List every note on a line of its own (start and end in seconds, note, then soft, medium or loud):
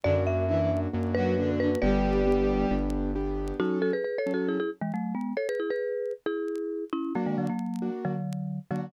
0.03 0.87 F#2 medium
0.03 0.14 D3 medium
0.03 0.44 A#3 medium
0.03 0.14 D4 loud
0.03 0.44 D4 medium
0.03 0.44 F#4 medium
0.03 0.24 D5 medium
0.27 0.80 E5 medium
0.49 0.59 E3 medium
0.49 0.89 A#3 medium
0.49 0.89 D4 medium
0.49 0.59 E4 medium
0.49 0.89 F#4 medium
0.59 0.70 E3 medium
0.59 0.70 E4 medium
0.93 1.76 F#2 medium
0.93 1.33 A#3 medium
0.93 1.33 D4 medium
0.93 1.33 F#4 medium
1.15 1.35 F#3 medium
1.15 1.35 F#4 loud
1.15 1.51 B4 medium
1.37 1.58 D3 medium
1.37 1.77 A#3 medium
1.37 1.77 D4 medium
1.37 1.58 D4 medium
1.37 1.77 F#4 medium
1.59 1.70 D3 medium
1.59 1.70 D4 medium
1.59 1.80 B4 medium
1.82 2.65 G1 medium
1.82 2.73 G3 loud
1.82 2.22 B3 medium
1.82 2.22 D4 loud
1.82 2.22 G4 medium
1.82 2.73 G4 loud
1.82 2.66 B4 medium
1.82 2.66 D5 medium
2.27 2.67 B3 loud
2.27 2.67 D4 medium
2.27 2.67 G4 medium
2.71 3.53 G1 medium
2.71 3.11 B3 medium
2.71 3.11 D4 medium
2.71 3.11 G4 medium
3.15 3.55 B3 medium
3.15 3.55 D4 medium
3.15 3.55 G4 medium
3.60 3.91 F#3 medium
3.60 3.91 C#4 medium
3.60 3.79 D#4 medium
3.60 3.79 F#4 medium
3.60 3.91 A4 medium
3.82 3.92 F#4 medium
3.82 3.92 A4 medium
3.93 4.04 G#4 medium
3.93 4.04 B4 medium
4.04 4.18 G#4 soft
4.04 4.18 B4 medium
4.18 4.32 A4 medium
4.18 4.32 C#5 medium
4.26 4.57 F#3 medium
4.26 4.57 C#4 medium
4.26 4.57 A4 medium
4.34 4.48 F#4 medium
4.34 4.48 A4 medium
4.48 4.59 E4 medium
4.48 4.59 G#4 medium
4.60 4.70 E4 medium
4.60 4.70 G#4 medium
4.81 4.92 E3 medium
4.81 4.92 G#3 medium
4.94 5.14 F#3 medium
4.94 5.14 A3 medium
5.15 5.34 G#3 medium
5.15 5.34 B3 medium
5.37 5.47 A4 medium
5.37 5.47 C#5 medium
5.49 5.59 G#4 medium
5.49 5.59 B4 medium
5.60 5.70 E4 medium
5.60 5.70 G#4 medium
5.70 6.13 G#4 medium
5.70 6.13 B4 medium
6.26 6.84 E4 medium
6.26 6.84 G#4 medium
6.93 7.13 C#4 medium
6.93 7.13 E4 medium
7.15 7.26 F#3 medium
7.15 7.46 A#3 medium
7.15 7.26 A#3 medium
7.15 7.46 D4 medium
7.15 7.46 F#4 medium
7.26 7.37 D#3 medium
7.26 7.37 G#3 medium
7.38 7.48 D3 medium
7.38 7.48 F#3 medium
7.49 7.90 F#3 medium
7.49 7.90 A#3 medium
7.82 8.13 A#3 medium
7.82 8.13 D4 medium
7.82 8.13 F#4 medium
8.05 8.59 D3 medium
8.05 8.59 F#3 medium
8.71 8.89 D3 medium
8.71 8.89 F#3 medium
8.71 8.86 A#3 medium
8.71 8.86 D4 medium
8.71 8.86 F#4 medium